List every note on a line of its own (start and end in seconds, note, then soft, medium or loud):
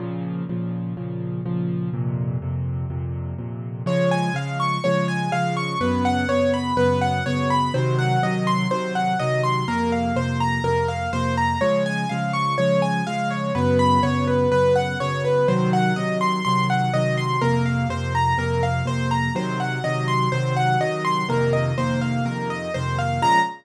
0.00 0.43 A#2 medium
0.00 0.43 C#3 medium
0.00 0.43 F3 medium
0.49 0.93 A#2 medium
0.49 0.93 C#3 medium
0.49 0.93 F3 medium
0.97 1.41 A#2 medium
0.97 1.41 C#3 medium
0.97 1.41 F3 medium
1.45 1.89 A#2 medium
1.45 1.89 C#3 medium
1.45 1.89 F3 medium
1.93 2.37 F2 medium
1.93 2.37 A#2 medium
1.93 2.37 C3 medium
2.42 2.86 F2 medium
2.42 2.86 A#2 medium
2.42 2.86 C3 medium
2.90 3.34 F2 medium
2.90 3.34 A#2 medium
2.90 3.34 C3 medium
3.38 3.82 F2 medium
3.38 3.82 A#2 medium
3.38 3.82 C3 medium
3.86 4.30 C#3 medium
3.86 4.30 F3 medium
3.86 4.30 G#3 medium
3.86 4.09 C#5 medium
4.11 4.34 G#5 medium
4.34 4.78 C#3 medium
4.34 4.78 F3 medium
4.34 4.78 G#3 medium
4.34 4.58 F5 medium
4.60 4.82 C#6 medium
4.84 5.28 C#3 medium
4.84 5.28 F3 medium
4.84 5.28 G#3 medium
4.84 5.06 C#5 medium
5.08 5.30 G#5 medium
5.32 5.75 C#3 medium
5.32 5.75 F3 medium
5.32 5.75 G#3 medium
5.32 5.54 F5 medium
5.57 5.79 C#6 medium
5.81 6.24 F#2 medium
5.81 6.24 C#3 medium
5.81 6.24 B3 medium
5.81 6.03 B4 medium
6.05 6.27 F#5 medium
6.28 6.72 F#2 medium
6.28 6.72 C#3 medium
6.28 6.72 B3 medium
6.28 6.51 C#5 medium
6.54 6.76 B5 medium
6.77 7.20 F#2 medium
6.77 7.20 C#3 medium
6.77 7.20 B3 medium
6.77 6.99 B4 medium
7.01 7.24 F#5 medium
7.26 7.70 F#2 medium
7.26 7.70 C#3 medium
7.26 7.70 B3 medium
7.26 7.48 C#5 medium
7.50 7.73 B5 medium
7.74 8.18 C3 medium
7.74 8.18 D#3 medium
7.74 8.18 F#3 medium
7.74 7.96 C5 medium
7.99 8.21 F#5 medium
8.23 8.66 C3 medium
8.23 8.66 D#3 medium
8.23 8.66 F#3 medium
8.23 8.45 D#5 medium
8.47 8.69 C6 medium
8.70 9.14 C3 medium
8.70 9.14 D#3 medium
8.70 9.14 F#3 medium
8.70 8.93 C5 medium
8.95 9.18 F#5 medium
9.19 9.64 C3 medium
9.19 9.64 D#3 medium
9.19 9.64 F#3 medium
9.19 9.42 D#5 medium
9.44 9.66 C6 medium
9.68 10.12 F2 medium
9.68 10.12 C3 medium
9.68 10.12 A#3 medium
9.68 9.90 A#4 medium
9.92 10.15 F5 medium
10.16 10.59 F2 medium
10.16 10.59 C3 medium
10.16 10.59 A#3 medium
10.16 10.39 C5 medium
10.40 10.63 A#5 medium
10.64 11.07 F2 medium
10.64 11.07 C3 medium
10.64 11.07 A#3 medium
10.64 10.86 A#4 medium
10.88 11.11 F5 medium
11.13 11.56 F2 medium
11.13 11.56 C3 medium
11.13 11.56 A#3 medium
11.13 11.35 C5 medium
11.37 11.60 A#5 medium
11.61 12.05 C#3 medium
11.61 12.05 F3 medium
11.61 12.05 G#3 medium
11.61 11.83 C#5 medium
11.86 12.08 G#5 medium
12.09 12.55 C#3 medium
12.09 12.55 F3 medium
12.09 12.55 G#3 medium
12.09 12.32 F5 medium
12.33 12.56 C#6 medium
12.58 13.02 C#3 medium
12.58 13.02 F3 medium
12.58 13.02 G#3 medium
12.58 12.80 C#5 medium
12.82 13.04 G#5 medium
13.07 13.51 C#3 medium
13.07 13.51 F3 medium
13.07 13.51 G#3 medium
13.07 13.29 F5 medium
13.31 13.53 C#5 medium
13.55 13.98 F#2 medium
13.55 13.98 C#3 medium
13.55 13.98 B3 medium
13.55 13.77 B4 medium
13.79 14.01 B5 medium
14.03 14.47 F#2 medium
14.03 14.47 C#3 medium
14.03 14.47 B3 medium
14.03 14.25 C#5 medium
14.27 14.50 B4 medium
14.52 14.95 F#2 medium
14.52 14.95 C#3 medium
14.52 14.95 B3 medium
14.52 14.74 B4 medium
14.76 14.98 F#5 medium
15.00 15.44 F#2 medium
15.00 15.44 C#3 medium
15.00 15.44 B3 medium
15.00 15.22 C#5 medium
15.25 15.47 B4 medium
15.48 15.92 C3 medium
15.48 15.92 D#3 medium
15.48 15.92 F#3 medium
15.48 15.70 C5 medium
15.73 15.95 F#5 medium
15.96 16.41 C3 medium
15.96 16.41 D#3 medium
15.96 16.41 F#3 medium
15.96 16.18 D#5 medium
16.21 16.43 C6 medium
16.45 16.90 C3 medium
16.45 16.90 D#3 medium
16.45 16.90 F#3 medium
16.45 16.67 C6 medium
16.70 16.92 F#5 medium
16.94 17.38 C3 medium
16.94 17.38 D#3 medium
16.94 17.38 F#3 medium
16.94 17.16 D#5 medium
17.17 17.40 C6 medium
17.41 17.85 F2 medium
17.41 17.85 C3 medium
17.41 17.85 A#3 medium
17.41 17.64 A#4 medium
17.66 17.88 F5 medium
17.89 18.33 F2 medium
17.89 18.33 C3 medium
17.89 18.33 A#3 medium
17.89 18.13 C5 medium
18.15 18.37 A#5 medium
18.38 18.81 F2 medium
18.38 18.81 C3 medium
18.38 18.81 A#3 medium
18.38 18.61 A#4 medium
18.63 18.85 F5 medium
18.86 19.29 F2 medium
18.86 19.29 C3 medium
18.86 19.29 A#3 medium
18.86 19.09 C5 medium
19.11 19.33 A#5 medium
19.35 19.79 C3 medium
19.35 19.79 D#3 medium
19.35 19.79 F#3 medium
19.35 19.58 C5 medium
19.60 19.82 F#5 medium
19.84 20.28 C3 medium
19.84 20.28 D#3 medium
19.84 20.28 F#3 medium
19.84 20.06 D#5 medium
20.08 20.30 C6 medium
20.32 20.76 C3 medium
20.32 20.76 D#3 medium
20.32 20.76 F#3 medium
20.32 20.54 C5 medium
20.56 20.79 F#5 medium
20.80 21.24 C3 medium
20.80 21.24 D#3 medium
20.80 21.24 F#3 medium
20.80 21.03 D#5 medium
21.05 21.27 C6 medium
21.29 21.72 F2 loud
21.29 21.72 C3 medium
21.29 21.72 D#3 medium
21.29 21.72 A#3 medium
21.29 21.52 A#4 medium
21.53 21.75 D#5 medium
21.78 22.21 F2 medium
21.78 22.21 C3 medium
21.78 22.21 D#3 medium
21.78 22.21 A#3 medium
21.78 22.00 C5 medium
22.02 22.24 F5 medium
22.25 22.68 F2 medium
22.25 22.68 C3 medium
22.25 22.68 D#3 medium
22.25 22.68 A#3 medium
22.25 22.48 A#4 medium
22.50 22.72 D#5 medium
22.74 23.19 F2 medium
22.74 23.19 C3 medium
22.74 23.19 D#3 medium
22.74 23.19 A#3 medium
22.74 22.96 C5 medium
22.98 23.21 F5 medium
23.22 23.39 A#2 medium
23.22 23.39 C#3 loud
23.22 23.39 F3 medium
23.22 23.39 G#3 medium
23.22 23.39 A#5 loud